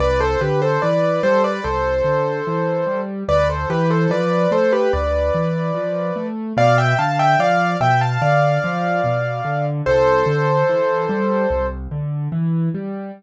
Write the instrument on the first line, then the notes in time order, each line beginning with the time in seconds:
acoustic grand piano
0.00 C2 B4 D5
0.20 A4 C5
0.41 D3 G4 B4
0.62 A4 C5
0.82 E3 B4 D5
1.23 G3 A4 C5
1.44 B4 D5
1.64 C2 A4 C5
2.04 D3
2.47 E3
2.87 G3
3.28 D2 B4 D5
3.49 A4 C5
3.70 E3 G4 B4
3.90 A4 C5
4.10 F3 B4 D5
4.51 A3 A4 C5
4.72 G4 B4
4.93 D2 B4 D5
5.35 E3
5.74 F3
6.16 A3
6.57 B2 D5 F5
6.78 E5 G5
6.99 D3 F5 A5
7.19 E5 G5
7.39 F3 D5 F5
7.80 B2 E5 G5
8.01 F5 A5
8.22 D3 D5 F5
8.64 F3
9.04 B2
9.45 D3
9.86 C2 A4 C5
10.26 D3
10.69 E3
11.09 G3
11.51 C2
11.91 D3
12.32 E3
12.74 G3